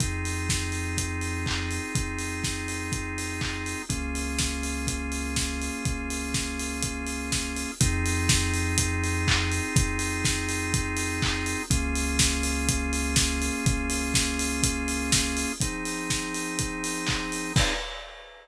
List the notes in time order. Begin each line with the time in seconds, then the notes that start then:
0.00 F2 C4 D#4 F4 G#4, kick, closed hi-hat
0.25 open hi-hat
0.49 kick, snare
0.72 open hi-hat
0.98 kick, closed hi-hat
1.21 open hi-hat
1.46 kick, clap
1.71 open hi-hat
1.95 F2, kick, closed hi-hat
2.18 open hi-hat
2.44 kick, snare
2.68 open hi-hat
2.92 kick, closed hi-hat
3.18 open hi-hat
3.41 kick, clap
3.66 open hi-hat
3.89 C#2 A#3 C#4 F4 G#4, kick, closed hi-hat
4.15 open hi-hat
4.39 kick, snare
4.63 open hi-hat
4.87 kick, closed hi-hat
5.12 open hi-hat
5.36 kick, snare
5.61 open hi-hat
5.85 C#2, kick, closed hi-hat
6.10 open hi-hat
6.34 kick, snare
6.59 open hi-hat
6.82 kick, closed hi-hat
7.07 open hi-hat
7.32 kick, snare
7.56 open hi-hat
7.80 F2 C4 D#4 F4 G#4, kick, closed hi-hat
8.06 open hi-hat
8.29 kick, snare
8.54 open hi-hat
8.78 kick, closed hi-hat
9.04 open hi-hat
9.28 kick, clap
9.52 open hi-hat
9.76 F2, kick, closed hi-hat
9.99 open hi-hat
10.25 kick, snare
10.49 open hi-hat
10.74 kick, closed hi-hat
10.97 open hi-hat
11.22 kick, clap
11.46 open hi-hat
11.70 C#2 A#3 C#4 F4 G#4, kick, closed hi-hat
11.95 open hi-hat
12.19 kick, snare
12.43 open hi-hat
12.69 kick, closed hi-hat
12.93 open hi-hat
13.16 kick, snare
13.42 open hi-hat
13.65 C#2, kick, closed hi-hat
13.90 open hi-hat
14.14 kick, snare
14.39 open hi-hat
14.63 kick, closed hi-hat
14.88 open hi-hat
15.12 kick, snare
15.37 open hi-hat
15.60 F3 C4 D#4 G#4, kick, closed hi-hat
15.85 open hi-hat
16.10 kick, snare
16.34 open hi-hat
16.59 kick, closed hi-hat
16.84 open hi-hat
17.07 kick, clap
17.32 open hi-hat
17.56 C4 D#4 F4 G#4, kick, crash